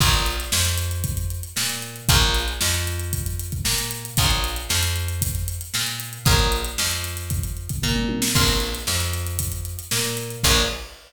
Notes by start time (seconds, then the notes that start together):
0.00 A#1 F4 G#4 A#4 C#5, kick, crash
0.14 closed hi-hat
0.26 closed hi-hat
0.40 closed hi-hat
0.52 F2 F3, snare
0.65 closed hi-hat
0.78 closed hi-hat
0.91 closed hi-hat
1.04 kick, closed hi-hat
1.17 closed hi-hat
1.30 closed hi-hat
1.43 closed hi-hat
1.56 A#2 A#3, snare
1.69 closed hi-hat
1.82 closed hi-hat
1.96 closed hi-hat
2.09 A#1 F4 G#4 A#4 C#5, kick, closed hi-hat
2.22 snare, closed hi-hat
2.34 snare, closed hi-hat
2.48 closed hi-hat
2.61 F2 F3, snare
2.74 closed hi-hat
2.87 closed hi-hat
3.00 closed hi-hat
3.13 kick, closed hi-hat
3.26 closed hi-hat
3.39 closed hi-hat
3.52 kick, closed hi-hat
3.65 A#2 A#3, snare
3.78 closed hi-hat
3.91 closed hi-hat
4.05 closed hi-hat
4.17 A#1 F4 G#4 A#4 C#5, kick, closed hi-hat
4.30 closed hi-hat
4.44 closed hi-hat
4.56 closed hi-hat
4.69 F2 F3, snare
4.83 closed hi-hat
4.96 closed hi-hat
5.08 closed hi-hat
5.22 kick, closed hi-hat
5.34 snare, closed hi-hat
5.48 closed hi-hat
5.61 closed hi-hat
5.74 A#2 A#3, snare
5.87 closed hi-hat
6.00 closed hi-hat
6.13 closed hi-hat
6.25 A#1 F4 G#4 A#4 C#5, kick, closed hi-hat
6.39 closed hi-hat
6.52 closed hi-hat
6.65 closed hi-hat
6.78 F2 F3, snare
6.91 closed hi-hat
7.04 closed hi-hat
7.17 snare, closed hi-hat
7.30 kick, closed hi-hat
7.43 closed hi-hat
7.57 closed hi-hat
7.69 kick, closed hi-hat
7.82 A#2 A#3, kick, floor tom
7.96 mid tom
8.09 high tom
8.22 snare
8.35 A#1 F4 G#4 A#4 C#5, kick, crash
8.48 closed hi-hat
8.60 closed hi-hat
8.75 closed hi-hat
8.87 F2 F3, snare
9.00 closed hi-hat
9.13 snare, closed hi-hat
9.27 closed hi-hat
9.39 kick, closed hi-hat
9.52 closed hi-hat
9.65 closed hi-hat
9.79 closed hi-hat
9.91 A#2 A#3, snare
10.05 closed hi-hat
10.17 snare, closed hi-hat
10.30 closed hi-hat
10.43 A#1 F4 G#4 A#4 C#5, kick, crash